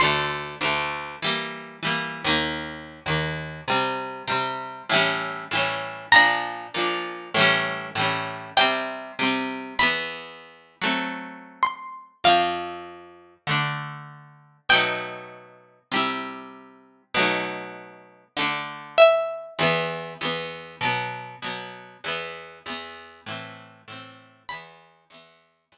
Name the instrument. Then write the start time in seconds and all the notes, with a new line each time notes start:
acoustic guitar (steel)
0.00 D2 D3 C6
0.04 A3
0.61 D2 D3 A3
1.22 E3 G3 A#3
1.83 E3 G3 A#3
2.24 D#2 D#3 A#3
3.06 D#2 D#3 A#3
3.68 C3 G3 C4
4.28 C3 G3 C4
4.89 A2 E3 G3
4.95 C#4
5.51 A2 E3 G3
5.57 C#4
6.12 A#2 F3 D4 A#5
6.74 A#2 F3 D4
7.34 A2 E3 G3
7.40 C#4
7.95 A2 E3 G3
8.01 C#4
8.57 C3 G3 C4 G5
9.19 C3 G3 C4
9.79 E2 E3 B3 B5
10.82 F#3 A3 C4
11.63 C6
12.24 F2 F3 C4 F5
13.47 D3 A3 D4
14.69 B2 F#3 A3 G5
14.75 D#4
15.92 C3 G3 E4
17.14 B2 F#3 A3
17.20 D#4
18.37 D3 A3 D4
18.98 E5
19.59 E2 E3 B3
20.21 E2 E3 B3
20.81 B2 F#3 B3
21.42 B2 F#3 B3
22.04 E2 E3 B3
22.66 E2 E3 B3
23.26 A2 E3 C4
23.88 A2 E3 C4
24.49 E2 E3 B5
24.54 B3
25.10 E2 E3 B3
25.72 E2 E3 B3